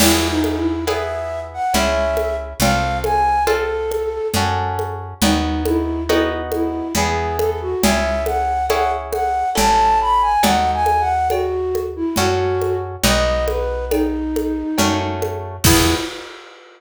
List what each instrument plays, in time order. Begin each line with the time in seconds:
0.00 electric bass (finger) E2, orchestral harp B3 E4 G#4, flute E4, crash, cowbell, low conga
0.30 flute D#4
0.44 high conga
0.57 flute E4
0.87 orchestral harp B3 E4 G#4, flute E5, cowbell, high conga
1.53 flute F#5
1.74 electric bass (finger) C#2, orchestral harp C#4 E4 G#4, flute E5, cowbell, low conga
2.17 high conga
2.60 electric bass (finger) C2, orchestral harp C4 F4 A4, flute F5, cowbell, low conga
3.04 flute G#5, high conga
3.47 orchestral harp C4 F4 A4, flute A4, cowbell, high conga
3.91 high conga
4.34 electric bass (finger) F#2, orchestral harp C#4 F#4 A4, cowbell, low conga
4.79 high conga
5.22 electric bass (finger) D#2, orchestral harp B3 D#4 F#4, flute D#4, cowbell, low conga
5.65 flute E4, high conga
6.09 orchestral harp B3 D#4 F#4, flute E4, cowbell, high conga
6.52 flute E4, high conga
6.95 electric bass (finger) E2, orchestral harp B3 E4 G#4, flute G#4, cowbell, low conga
7.39 flute A4, high conga
7.61 flute F#4
7.82 electric bass (finger) C#2, orchestral harp C#4 E4 G#4, flute E5, cowbell, low conga
8.26 flute F#5, high conga
8.69 orchestral harp C#4 E4 G#4, flute F#5, cowbell, high conga
9.12 flute F#5, high conga
9.55 electric bass (finger) A1, orchestral harp C#4 E4 A4, flute A5, cowbell, low conga
10.01 flute B5
10.21 flute G#5
10.43 electric bass (finger) D#2, orchestral harp D#4 F#4 A4, flute F#5, cowbell, low conga
10.74 flute G#5
10.86 high conga
11.00 flute F#5
11.30 flute F#4, cowbell, high conga
11.75 high conga
11.96 flute E4
12.16 electric bass (finger) F#2, orchestral harp C#4 F#4 A4, flute F#4, cowbell, low conga
12.62 high conga
13.03 electric bass (finger) B1, orchestral harp B3 D#4 F#4, flute D#5, cowbell, low conga
13.48 flute B4, high conga
13.91 flute D#4, cowbell, high conga
14.36 high conga
14.78 electric bass (finger) F#2, orchestral harp A3 C#4 F#4, cowbell, low conga
15.22 high conga
15.64 electric bass (finger) E2, orchestral harp B3 E4 G#4, flute E4, kick, crash